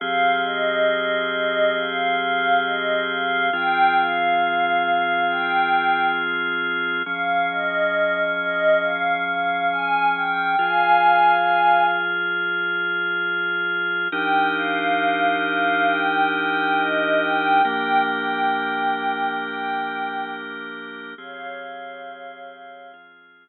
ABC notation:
X:1
M:4/4
L:1/8
Q:1/4=68
K:Fm
V:1 name="Pad 5 (bowed)"
f e2 e f f e f | g f3 g2 z2 | f e2 e f f a g | [fa]3 z5 |
g f2 f g g e g | g g3 g2 z2 | [df]4 z4 |]
V:2 name="Drawbar Organ"
[F,CGA]8 | [F,CFA]8 | [F,DA]8 | [F,FA]8 |
[F,=DEGB]8 | [F,B,=DGB]8 | [F,CGA]4 [F,CFA]4 |]